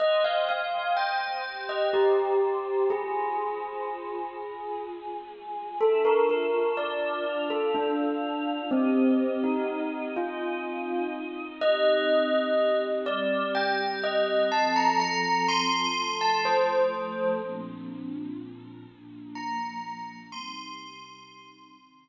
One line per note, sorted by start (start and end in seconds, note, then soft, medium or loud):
0.00 1.44 C5 medium
0.00 0.23 D#5 loud
0.00 1.44 D#5 medium
0.00 1.44 G5 medium
0.24 0.47 F5 medium
0.49 0.91 F5 medium
0.97 1.62 G5 medium
1.46 2.89 G4 medium
1.46 2.89 C5 medium
1.46 2.89 G5 medium
1.69 1.92 D#5 medium
1.93 2.85 G4 medium
2.90 4.34 F4 medium
2.90 4.79 G#4 medium
2.90 4.35 C5 medium
2.90 4.34 G#5 medium
4.35 5.79 F4 medium
4.35 5.79 G#4 medium
4.35 5.79 G#5 medium
5.81 7.25 D4 medium
5.81 7.25 F4 medium
5.81 6.04 A4 medium
5.81 7.25 E5 medium
5.81 7.25 A5 medium
6.05 6.28 A#4 medium
6.29 6.70 A#4 medium
6.77 7.38 D5 medium
7.26 8.70 D4 medium
7.26 8.70 F4 medium
7.26 8.70 F5 medium
7.26 8.70 A5 medium
7.50 7.73 A4 medium
7.75 8.62 D4 medium
8.71 9.40 C4 medium
8.71 10.15 C4 medium
8.71 10.15 G4 medium
8.71 10.15 D#5 medium
9.44 10.07 D#4 medium
10.16 11.60 C4 medium
10.16 11.60 D#4 medium
10.16 11.07 F4 medium
10.16 11.60 D#5 medium
11.61 13.05 C4 medium
11.61 13.05 D#4 medium
11.61 13.05 G4 medium
11.61 12.79 D#5 loud
13.06 14.50 G3 medium
13.06 14.50 C4 medium
13.06 14.50 G4 medium
13.06 13.46 D5 medium
13.55 13.97 G5 medium
14.03 14.45 D#5 medium
14.52 15.96 F3 medium
14.52 15.96 C4 medium
14.52 15.96 A4 medium
14.52 14.75 A5 medium
14.76 14.99 A#5 medium
15.00 15.45 A#5 loud
15.48 16.13 C6 loud
15.96 17.40 F3 medium
15.96 17.40 A3 medium
15.96 17.40 A4 medium
16.21 16.44 A5 medium
16.45 17.27 C5 medium
17.42 18.86 A#2 medium
17.42 18.86 F3 medium
17.42 18.86 C4 medium
17.42 18.86 D4 medium
18.88 20.32 A#2 medium
18.88 20.32 F3 medium
18.88 20.32 A#3 medium
18.88 20.32 D4 medium
19.35 20.16 A#5 medium
20.32 21.76 C3 medium
20.32 21.76 G3 medium
20.32 21.76 D#4 medium
20.32 22.09 C6 loud
21.77 22.09 C3 medium
21.77 22.09 D#3 medium
21.77 22.09 D#4 medium